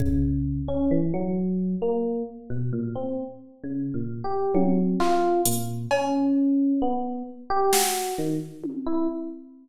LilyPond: <<
  \new Staff \with { instrumentName = "Electric Piano 1" } { \time 2/4 \tempo 4 = 66 des8. des'16 e16 ges8. | bes8 r16 b,16 bes,16 c'16 r8 | \tuplet 3/2 { des8 bes,8 g'8 } ges8 f'8 | bes,8 des'4 b8 |
r16 g'16 ges'8 ees16 r8 e'16 | }
  \new DrumStaff \with { instrumentName = "Drums" } \drummode { \time 2/4 bd4 r4 | r4 r4 | r4 tommh8 hc8 | hh8 cb8 r4 |
r8 sn8 r8 tommh8 | }
>>